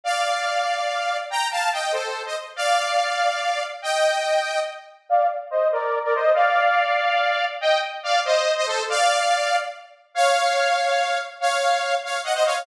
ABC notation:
X:1
M:6/8
L:1/16
Q:3/8=95
K:Bb
V:1 name="Lead 2 (sawtooth)"
[df]12 | [gb]2 [fa]2 [eg]2 [Ac]3 [ce] z2 | [df]12 | [eg]8 z4 |
[df]2 z2 [ce]2 [Bd]3 [Bd] [ce]2 | [df]12 | [eg]2 z2 [df]2 [ce]3 [ce] [Ac]2 | [df]8 z4 |
[K:Bbm] [df]12 | [df]6 [df]2 [eg] [ce] [df]2 |]